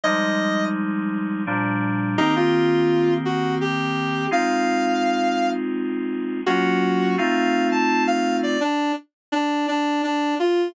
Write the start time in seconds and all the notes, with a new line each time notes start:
0.04 F3 G3 G#3 D#4 D#5
1.47 A#2 F3 G3 D4
2.17 D#3 A#3 C4 D#4 G4
2.36 F4
3.25 F#4
3.61 G4
4.31 G#3 C4 D#4 F4 F5
6.46 F#3 A#3 C#4 F4 F#4
7.18 A3 C4 D#4 F4 F5
7.71 A5
8.07 F5
8.43 D5
8.61 D4
9.32 D4
9.68 D4
10.04 D4
10.39 F4